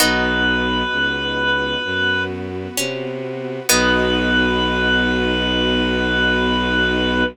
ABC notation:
X:1
M:4/4
L:1/8
Q:1/4=65
K:B
V:1 name="Drawbar Organ"
B5 z3 | B8 |]
V:2 name="Harpsichord"
D6 C2 | B,8 |]
V:3 name="Acoustic Guitar (steel)"
[B,DF]8 | [B,DF]8 |]
V:4 name="Violin" clef=bass
B,,,2 C,,2 F,,2 =C,2 | B,,,8 |]
V:5 name="String Ensemble 1"
[B,DF]4 [B,FB]4 | [B,DF]8 |]